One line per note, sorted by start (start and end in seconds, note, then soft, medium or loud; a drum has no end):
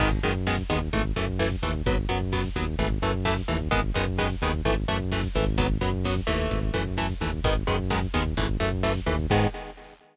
0.00 0.20 G#1 loud
0.00 0.09 D#3 loud
0.00 0.09 G#3 loud
0.00 0.09 B3 loud
0.00 kick loud
0.00 crash loud
0.12 kick loud
0.23 0.63 F#2 medium
0.23 0.33 D#3 loud
0.23 0.33 G#3 medium
0.23 0.33 B3 medium
0.23 kick medium
0.23 closed hi-hat medium
0.35 kick medium
0.47 0.56 D#3 medium
0.47 0.56 G#3 medium
0.47 0.56 B3 medium
0.47 kick medium
0.47 snare loud
0.58 kick loud
0.69 0.89 D#2 medium
0.69 0.79 D#3 medium
0.69 0.79 G#3 medium
0.69 0.79 B3 medium
0.69 kick loud
0.69 closed hi-hat medium
0.81 kick medium
0.93 1.12 G#1 medium
0.93 1.02 E3 medium
0.93 1.02 A3 loud
0.93 kick loud
0.93 closed hi-hat loud
1.05 kick medium
1.16 1.56 F#2 medium
1.16 1.25 E3 medium
1.16 1.25 A3 medium
1.16 kick medium
1.16 closed hi-hat medium
1.28 kick loud
1.39 1.49 E3 loud
1.39 1.49 A3 medium
1.39 kick medium
1.39 snare loud
1.51 kick loud
1.62 1.82 D#2 medium
1.62 1.72 E3 medium
1.62 1.72 A3 medium
1.62 kick medium
1.62 closed hi-hat medium
1.75 kick medium
1.86 2.06 G#1 medium
1.86 1.96 F#3 loud
1.86 1.96 B3 loud
1.86 kick loud
1.86 closed hi-hat loud
1.98 kick medium
2.09 2.49 F#2 medium
2.09 2.18 F#3 medium
2.09 2.18 B3 medium
2.09 kick medium
2.09 closed hi-hat medium
2.21 kick medium
2.33 2.42 F#3 loud
2.33 2.42 B3 medium
2.33 kick loud
2.33 snare loud
2.44 kick medium
2.56 2.75 D#2 medium
2.56 2.65 F#3 medium
2.56 2.65 B3 medium
2.56 kick loud
2.56 closed hi-hat medium
2.67 kick medium
2.79 2.99 G#1 medium
2.79 2.88 E3 loud
2.79 2.88 A3 medium
2.79 kick loud
2.79 closed hi-hat loud
2.91 kick medium
3.02 3.42 F#2 medium
3.02 3.12 E3 medium
3.02 3.12 A3 loud
3.02 kick loud
3.02 closed hi-hat medium
3.14 kick medium
3.25 3.34 E3 medium
3.25 3.34 A3 loud
3.25 kick loud
3.25 snare loud
3.37 kick medium
3.48 3.69 D#2 medium
3.48 3.57 E3 medium
3.48 3.57 A3 medium
3.48 kick medium
3.48 closed hi-hat medium
3.60 kick loud
3.71 3.91 G#1 medium
3.71 3.80 D#3 loud
3.71 3.80 G#3 loud
3.71 3.80 B3 loud
3.71 kick loud
3.71 closed hi-hat loud
3.84 kick medium
3.95 4.35 F#2 medium
3.95 4.05 D#3 medium
3.95 4.05 G#3 medium
3.95 4.05 B3 medium
3.95 kick loud
3.95 closed hi-hat medium
4.07 kick loud
4.19 4.28 D#3 medium
4.19 4.28 G#3 medium
4.19 4.28 B3 loud
4.19 kick loud
4.19 snare loud
4.30 kick loud
4.42 4.62 D#2 medium
4.42 4.52 D#3 loud
4.42 4.52 G#3 medium
4.42 4.52 B3 medium
4.42 kick loud
4.42 closed hi-hat medium
4.53 kick medium
4.65 4.85 G#1 medium
4.65 4.75 E3 loud
4.65 4.75 A3 loud
4.65 kick medium
4.65 closed hi-hat loud
4.77 kick medium
4.88 5.28 F#2 medium
4.88 4.98 E3 medium
4.88 4.98 A3 medium
4.88 kick medium
4.88 closed hi-hat loud
5.00 kick medium
5.12 5.21 E3 medium
5.12 5.21 A3 medium
5.12 kick loud
5.12 snare loud
5.23 kick loud
5.35 5.78 G#1 loud
5.35 5.45 E3 medium
5.35 5.45 A3 medium
5.35 kick loud
5.35 open hi-hat medium
5.47 kick loud
5.58 5.67 F#3 loud
5.58 5.67 B3 loud
5.58 kick loud
5.58 closed hi-hat loud
5.70 kick loud
5.81 6.21 F#2 medium
5.81 5.90 F#3 medium
5.81 5.90 B3 medium
5.81 kick loud
5.81 closed hi-hat medium
5.93 kick medium
6.05 6.15 F#3 medium
6.05 6.15 B3 medium
6.05 kick loud
6.05 snare loud
6.16 kick loud
6.27 6.48 D#2 medium
6.27 6.59 E3 medium
6.27 6.59 A3 loud
6.27 kick loud
6.27 closed hi-hat medium
6.40 kick medium
6.51 6.71 G#1 medium
6.51 kick loud
6.51 closed hi-hat loud
6.63 kick medium
6.74 7.14 F#2 medium
6.74 6.83 E3 loud
6.74 6.83 A3 medium
6.74 kick medium
6.74 closed hi-hat loud
6.86 kick loud
6.98 7.07 E3 medium
6.98 7.07 A3 medium
6.98 kick medium
6.98 snare loud
7.09 kick medium
7.21 7.40 D#2 medium
7.21 7.31 E3 medium
7.21 7.31 A3 medium
7.21 kick loud
7.21 closed hi-hat medium
7.33 kick loud
7.44 7.64 G#1 medium
7.44 7.54 D#3 loud
7.44 7.54 G#3 medium
7.44 7.54 B3 loud
7.44 kick loud
7.44 closed hi-hat loud
7.56 kick medium
7.67 8.07 F#2 medium
7.67 7.76 D#3 medium
7.67 7.76 G#3 medium
7.67 7.76 B3 medium
7.67 kick loud
7.67 closed hi-hat medium
7.79 kick medium
7.90 8.00 D#3 medium
7.90 8.00 G#3 medium
7.90 8.00 B3 medium
7.90 kick loud
7.90 snare loud
8.02 kick medium
8.14 8.34 D#2 medium
8.14 8.23 D#3 medium
8.14 8.23 G#3 medium
8.14 8.23 B3 medium
8.14 kick loud
8.14 closed hi-hat medium
8.26 kick loud
8.37 8.57 G#1 medium
8.37 8.47 E3 loud
8.37 8.47 A3 loud
8.37 kick loud
8.37 closed hi-hat loud
8.49 kick loud
8.60 9.00 F#2 medium
8.60 8.69 E3 medium
8.60 8.69 A3 medium
8.60 kick medium
8.60 closed hi-hat medium
8.72 kick loud
8.83 8.93 E3 medium
8.83 8.93 A3 loud
8.83 kick loud
8.83 snare loud
8.95 kick medium
9.06 9.27 D#2 medium
9.06 9.16 E3 medium
9.06 9.16 A3 medium
9.06 kick loud
9.06 closed hi-hat medium
9.19 kick loud
9.30 9.47 G#2 loud
9.30 9.47 D#3 loud
9.30 9.47 G#3 loud
9.30 9.47 B3 loud
9.30 kick loud
9.30 crash loud